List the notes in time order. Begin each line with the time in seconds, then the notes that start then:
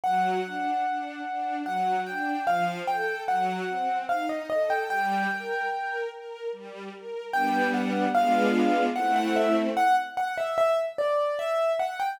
0.04 F#3 F#5
0.45 D4
0.84 D4
1.26 D4
1.65 F#3 F#5
2.06 D4 G5
2.47 F3 F5
2.87 A4 G5
3.28 F#3 F#5
3.69 C4
4.09 D#4 F5
4.29 D#5
4.50 A4 D#5
4.70 G5
4.90 G3 G5
5.31 A#4
5.71 A#4
6.11 A#4
6.53 G3
6.93 A#4
7.33 G3 B3 D4 G5
7.74 F#5
8.14 G#3 B3 D4 F4 F5
8.96 A3 C4 E4 F#5
9.16 F#5
9.36 E5
9.77 F#5
10.17 F#5
10.38 E5
10.58 E5
10.98 D5
11.39 E5
11.79 F#5
12.00 G5